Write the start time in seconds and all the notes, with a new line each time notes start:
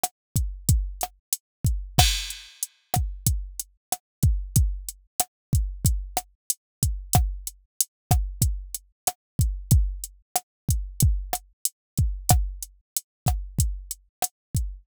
0.03 cross-stick, closed hi-hat
0.36 kick, closed hi-hat
0.69 kick, closed hi-hat
1.01 cross-stick, closed hi-hat
1.33 closed hi-hat
1.65 kick, closed hi-hat
1.98 kick, cross-stick, crash
2.30 closed hi-hat
2.63 closed hi-hat
2.94 kick, cross-stick, closed hi-hat
3.26 kick, closed hi-hat
3.60 closed hi-hat
3.92 cross-stick, closed hi-hat
4.23 kick, closed hi-hat
4.56 kick, closed hi-hat
4.88 closed hi-hat
5.20 cross-stick, closed hi-hat
5.53 kick, closed hi-hat
5.85 kick, closed hi-hat
6.17 cross-stick, closed hi-hat
6.50 closed hi-hat
6.83 kick, closed hi-hat
7.13 kick, cross-stick, closed hi-hat
7.47 closed hi-hat
7.81 closed hi-hat
8.11 kick, cross-stick, closed hi-hat
8.42 kick, closed hi-hat
8.74 closed hi-hat
9.07 cross-stick, closed hi-hat
9.39 kick, closed hi-hat
9.71 kick, closed hi-hat
10.04 closed hi-hat
10.35 cross-stick, closed hi-hat
10.69 kick, closed hi-hat
11.00 kick, closed hi-hat
11.33 cross-stick, closed hi-hat
11.65 closed hi-hat
11.97 kick, closed hi-hat
12.29 kick, cross-stick, closed hi-hat
12.62 closed hi-hat
12.97 closed hi-hat
13.26 kick, cross-stick, closed hi-hat
13.58 kick, closed hi-hat
13.91 closed hi-hat
14.22 cross-stick, closed hi-hat
14.55 kick, closed hi-hat